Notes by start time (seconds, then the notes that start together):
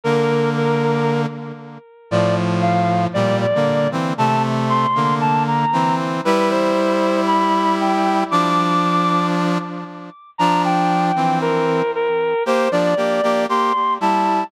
0.04 D3 A#3 A#4
0.57 A#4
2.11 A2 F3 D5
2.62 F5
3.14 A#2 G3 D5
3.41 D5
3.55 D3 A#3
3.92 E3 C4
4.18 C3 A3 A5
4.69 C6
4.95 D3 A#3
5.21 A5
5.47 A#5
5.73 E3 C4
6.25 G3 E4 B4
6.50 C5
7.27 B5
7.80 G5
8.31 F3 D4 D6
10.38 F3 D4 A#5
10.64 G5
11.16 E3 C4
11.41 A#4
11.95 A#4
12.46 A#3 G4 C5
12.72 F3 D4 D5
12.97 A#3 G4
13.23 A#3 G4
13.49 A#3 G4 C6
14.01 G3 E4 A5